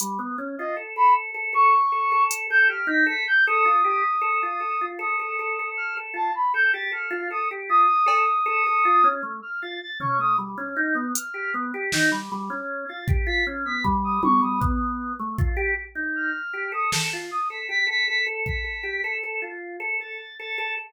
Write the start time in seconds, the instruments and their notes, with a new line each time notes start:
0.00 drawbar organ G3, closed hi-hat
0.19 drawbar organ B3
0.38 drawbar organ C#4
0.58 drawbar organ F4, brass section D#5
0.77 drawbar organ A4
0.96 drawbar organ A4, brass section B5
1.34 drawbar organ A4
1.53 drawbar organ A4, brass section C#6
1.92 drawbar organ A4
2.12 drawbar organ A4
2.31 closed hi-hat
2.50 drawbar organ A4, brass section G6
2.69 drawbar organ G4, brass section F6
2.87 drawbar organ D#4, brass section B6
3.06 drawbar organ A4, brass section B6
3.27 brass section G6
3.46 drawbar organ A4, brass section D#6
3.65 drawbar organ F4
3.84 drawbar organ G4
4.21 drawbar organ A4
4.43 drawbar organ F4
4.60 drawbar organ A4
4.81 drawbar organ F4
4.99 drawbar organ A4, brass section D#6
5.20 drawbar organ A4
5.39 drawbar organ A4
5.59 drawbar organ A4
5.77 brass section F6
5.97 drawbar organ A4
6.14 drawbar organ F4, brass section A5
6.35 brass section B5
6.54 drawbar organ A4, brass section G6
6.73 drawbar organ G4, brass section A6
6.92 drawbar organ A4, brass section F6
7.11 drawbar organ F4
7.30 drawbar organ A4, brass section D#6
7.51 drawbar organ G4
7.69 drawbar organ F4, brass section D#6
8.06 drawbar organ A4, cowbell
8.46 drawbar organ A4
8.67 drawbar organ A4
8.85 drawbar organ F4
9.04 drawbar organ C#4
9.23 drawbar organ A3
9.42 brass section F6
9.62 drawbar organ F4, brass section A6
9.81 brass section A6
10.00 drawbar organ C#4, brass section C#6, floor tom
10.19 drawbar organ A3, brass section D#6
10.38 drawbar organ G3
10.58 drawbar organ C#4
10.76 drawbar organ D#4
10.95 drawbar organ B3
11.15 brass section F6, closed hi-hat
11.34 drawbar organ G4
11.54 drawbar organ B3
11.74 drawbar organ G4
11.92 drawbar organ D#4, snare
12.12 drawbar organ G3
12.32 drawbar organ G3
12.50 drawbar organ C#4
12.88 drawbar organ F4, brass section A6
13.08 drawbar organ G4, kick
13.27 drawbar organ F4, brass section B6
13.47 drawbar organ C#4
13.65 drawbar organ B3, brass section B6
13.84 drawbar organ G3, kick
14.04 brass section D#6
14.23 drawbar organ G3, brass section C#6, high tom
14.42 drawbar organ G3, brass section D#6
14.61 drawbar organ B3, kick
15.19 drawbar organ A3
15.38 drawbar organ F4, kick
15.57 drawbar organ G4
15.95 drawbar organ D#4
16.15 brass section F6
16.53 drawbar organ G4
16.72 drawbar organ A4, brass section D#6
16.92 drawbar organ A4, snare
17.13 drawbar organ F4
17.31 brass section D#6
17.50 drawbar organ A4, brass section B6
17.69 drawbar organ G4, brass section B6
17.87 drawbar organ A4, brass section B6
18.08 drawbar organ A4, brass section B6
18.26 drawbar organ A4
18.46 drawbar organ A4, brass section B6, kick
18.64 drawbar organ A4
18.83 drawbar organ G4
19.04 drawbar organ A4
19.23 drawbar organ A4
19.42 drawbar organ F4
19.80 drawbar organ A4
20.00 drawbar organ A4, brass section A6
20.38 drawbar organ A4, brass section A6
20.58 drawbar organ A4